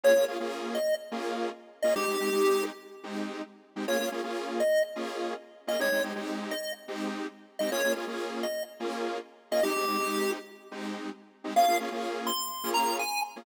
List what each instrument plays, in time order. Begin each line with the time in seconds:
0.04 lead 2 (sawtooth) A#3 C#4 F4 G#4, lead 1 (square) C#5
0.16 lead 2 (sawtooth) A#3 C#4 F4 G#4
0.28 lead 2 (sawtooth) A#3 C#4 F4 G#4
0.40 lead 2 (sawtooth) A#3 C#4 F4 G#4
0.75 lead 1 (square) D#5
1.11 lead 2 (sawtooth) A#3 C#4 F4 G#4
1.82 lead 2 (sawtooth) A#3 C#4 F4 G#4, lead 1 (square) D#5
1.95 lead 2 (sawtooth) G#3 C4 D#4 G4, lead 1 (square) G4
2.08 lead 2 (sawtooth) G#3 C4 D#4 G4
2.20 lead 2 (sawtooth) G#3 C4 D#4 G4
2.32 lead 2 (sawtooth) G#3 C4 D#4 G4
3.03 lead 2 (sawtooth) G#3 C4 D#4 G4
3.76 lead 2 (sawtooth) G#3 C4 D#4 G4
3.88 lead 2 (sawtooth) A#3 C#4 F4 G#4, lead 1 (square) C#5
4.00 lead 2 (sawtooth) A#3 C#4 F4 G#4
4.12 lead 2 (sawtooth) A#3 C#4 F4 G#4
4.23 lead 2 (sawtooth) A#3 C#4 F4 G#4
4.60 lead 1 (square) D#5
4.96 lead 2 (sawtooth) A#3 C#4 F4 G#4
5.67 lead 2 (sawtooth) A#3 C#4 F4 G#4, lead 1 (square) D#5
5.79 lead 2 (sawtooth) G#3 C4 D#4 G4, lead 1 (square) C#5
5.92 lead 2 (sawtooth) G#3 C4 D#4 G4
6.03 lead 2 (sawtooth) G#3 C4 D#4 G4
6.15 lead 2 (sawtooth) G#3 C4 D#4 G4
6.51 lead 1 (square) D#5
6.88 lead 2 (sawtooth) G#3 C4 D#4 G4
7.59 lead 2 (sawtooth) G#3 C4 D#4 G4, lead 1 (square) D#5
7.72 lead 2 (sawtooth) A#3 C#4 F4 G#4, lead 1 (square) C#5
7.84 lead 2 (sawtooth) A#3 C#4 F4 G#4
7.96 lead 2 (sawtooth) A#3 C#4 F4 G#4
8.07 lead 2 (sawtooth) A#3 C#4 F4 G#4
8.43 lead 1 (square) D#5
8.80 lead 2 (sawtooth) A#3 C#4 F4 G#4
9.51 lead 2 (sawtooth) A#3 C#4 F4 G#4, lead 1 (square) D#5
9.63 lead 2 (sawtooth) G#3 C4 D#4 G4, lead 1 (square) G4
9.76 lead 2 (sawtooth) G#3 C4 D#4 G4
9.88 lead 2 (sawtooth) G#3 C4 D#4 G4
9.99 lead 2 (sawtooth) G#3 C4 D#4 G4
10.71 lead 2 (sawtooth) G#3 C4 D#4 G4
11.44 lead 2 (sawtooth) G#3 C4 D#4 G4
11.56 lead 2 (sawtooth) A#3 C#4 F4 G#4, lead 1 (square) F5
11.68 lead 2 (sawtooth) A#3 C#4 F4 G#4
11.80 lead 2 (sawtooth) A#3 C#4 F4 G#4
11.92 lead 2 (sawtooth) A#3 C#4 F4 G#4
12.27 lead 1 (square) C6
12.64 lead 2 (sawtooth) A#3 C#4 F4 G#4
12.74 lead 1 (square) A#5
12.99 lead 1 (square) G#5
13.36 lead 2 (sawtooth) A#3 C#4 F4 G#4